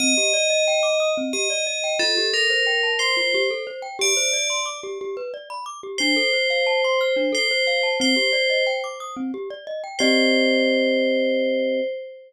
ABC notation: X:1
M:6/8
L:1/16
Q:3/8=60
K:Cdor
V:1 name="Tubular Bells"
e8 e4 | A2 B4 c3 z3 | d4 z8 | c8 c4 |
c4 z8 | c12 |]
V:2 name="Glockenspiel"
C G d e g d' e' C G d e g | F G A c g a c' F G A c g | G c d c' d' G G =B d =b d' G | D A c f a c' f' D A c f a |
C G d e g d' e' C G d e g | [CGde]12 |]